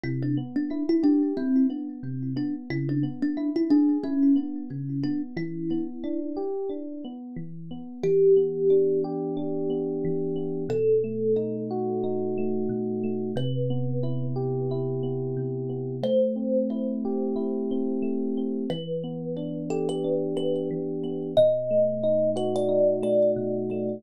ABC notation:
X:1
M:4/4
L:1/16
Q:"Swing 16ths" 1/4=90
K:Em
V:1 name="Kalimba"
E D z D2 E D2 C2 z4 D z | E D z D2 E D2 ^C2 z4 D z | E6 z10 | G6 z10 |
A6 z10 | B6 z10 | c6 z10 | B6 A B3 B2 z4 |
^d6 B =d3 d2 z4 |]
V:2 name="Electric Piano 1"
C,2 B,2 E2 G2 E2 B,2 C,2 B,2 | ^C,2 B,2 E2 ^G2 E2 B,2 C,2 B,2 | E,2 B,2 D2 G2 D2 B,2 E,2 B,2 | E,2 B,2 D2 G2 D2 B,2 E,2 B,2 |
B,,2 A,2 ^D2 F2 D2 A,2 B,,2 A,2 | C,2 B,2 E2 G2 E2 B,2 C,2 B,2 | A,2 C2 E2 G2 E2 C2 A,2 C2 | E,2 B,2 D2 G2 D2 B,2 E,2 B,2 |
B,,2 A,2 ^D2 F2 D2 A,2 B,,2 A,2 |]